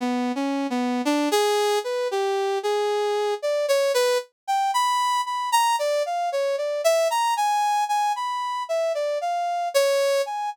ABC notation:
X:1
M:5/4
L:1/16
Q:1/4=57
K:none
V:1 name="Brass Section"
(3B,2 _D2 B,2 =D _A2 B G2 A3 d _d B z g b2 | b _b d f _d =d e b _a2 a =b2 e d f2 _d2 a |]